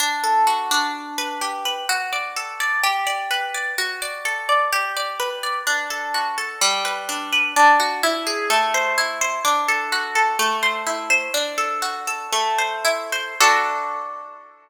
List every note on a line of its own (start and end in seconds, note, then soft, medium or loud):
0.00 0.71 D4 loud
0.24 0.91 A4 medium
0.47 0.92 F#4 medium
0.71 1.84 D4 loud
1.18 1.65 B4 medium
1.41 1.86 G4 medium
1.65 1.88 B4 medium
1.89 2.79 F#4 loud
2.13 2.60 D5 medium
2.36 2.81 A4 medium
2.60 2.83 D5 medium
2.83 3.73 G4 loud
3.07 3.54 D5 medium
3.31 3.75 B4 medium
3.54 3.77 D5 medium
3.78 4.68 F#4 medium
4.02 4.48 D5 medium
4.25 4.70 A4 medium
4.49 4.71 D5 medium
4.73 5.62 G4 loud
4.97 5.43 D5 medium
5.20 5.65 B4 medium
5.43 5.66 D5 medium
5.67 6.57 D4 medium
5.90 6.37 A4 medium
6.14 6.59 F#4 medium
6.38 6.60 A4 medium
6.61 7.51 G3 medium
6.85 7.32 B4 medium
7.09 7.54 D4 medium
7.32 7.55 B4 medium
7.56 8.01 D4 medium
7.80 8.02 F#4 medium
8.03 8.48 E4 loud
8.27 8.49 G#4 medium
8.50 9.40 A3 loud
8.74 9.21 C5 medium
8.98 9.43 E4 medium
9.21 9.44 C5 medium
9.45 10.34 D4 medium
9.68 10.15 A4 medium
9.92 10.37 F#4 medium
10.15 10.38 A4 medium
10.39 11.29 A3 medium
10.63 11.10 C5 medium
10.87 11.31 E4 medium
11.10 11.32 C5 medium
11.34 12.27 D4 medium
11.58 12.07 A4 medium
11.82 12.30 F#4 medium
12.07 12.31 A4 medium
12.33 13.35 A3 medium
12.58 13.12 C5 medium
12.85 13.37 E4 medium
13.12 13.39 C5 medium
13.41 14.69 D4 medium
13.41 14.69 F#4 medium
13.41 14.69 A4 medium